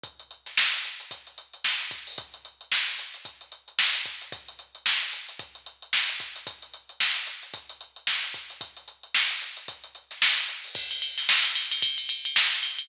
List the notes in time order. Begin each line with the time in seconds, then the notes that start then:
0.04 kick, closed hi-hat
0.20 closed hi-hat
0.31 closed hi-hat
0.46 snare, closed hi-hat
0.57 snare
0.73 closed hi-hat
0.84 closed hi-hat
1.00 closed hi-hat
1.11 kick, closed hi-hat
1.27 closed hi-hat
1.38 closed hi-hat
1.53 closed hi-hat
1.64 snare
1.80 closed hi-hat
1.91 kick, closed hi-hat
2.07 open hi-hat
2.18 kick, closed hi-hat
2.34 closed hi-hat
2.45 closed hi-hat
2.61 closed hi-hat
2.72 snare
2.88 closed hi-hat
2.99 closed hi-hat
3.14 closed hi-hat
3.25 kick, closed hi-hat
3.41 closed hi-hat
3.52 closed hi-hat
3.68 closed hi-hat
3.79 snare
3.95 closed hi-hat
4.06 kick, closed hi-hat
4.21 closed hi-hat
4.32 kick, closed hi-hat
4.48 closed hi-hat
4.59 closed hi-hat
4.75 closed hi-hat
4.86 snare
5.02 closed hi-hat
5.13 closed hi-hat
5.29 closed hi-hat
5.39 kick, closed hi-hat
5.55 closed hi-hat
5.66 closed hi-hat
5.82 closed hi-hat
5.93 snare
6.09 closed hi-hat
6.20 kick, snare, closed hi-hat
6.36 closed hi-hat
6.47 kick, closed hi-hat
6.62 closed hi-hat
6.74 closed hi-hat
6.89 closed hi-hat
7.00 snare
7.16 closed hi-hat
7.27 closed hi-hat
7.43 closed hi-hat
7.54 kick, closed hi-hat
7.70 closed hi-hat
7.81 closed hi-hat
7.96 closed hi-hat
8.07 snare
8.23 closed hi-hat
8.34 kick, closed hi-hat
8.50 closed hi-hat
8.61 kick, closed hi-hat
8.77 closed hi-hat
8.88 closed hi-hat
9.03 closed hi-hat
9.15 snare
9.30 closed hi-hat
9.42 closed hi-hat
9.57 closed hi-hat
9.68 kick, closed hi-hat
9.84 closed hi-hat
9.95 closed hi-hat
10.11 snare, closed hi-hat
10.22 snare
10.37 closed hi-hat
10.49 closed hi-hat
10.64 open hi-hat
10.75 kick, crash
10.91 ride
11.02 ride
11.18 snare, ride
11.29 snare
11.45 ride
11.55 snare, ride
11.72 snare, ride
11.82 kick, ride
11.98 ride
12.09 ride
12.25 ride
12.36 snare
12.52 ride
12.63 ride
12.79 ride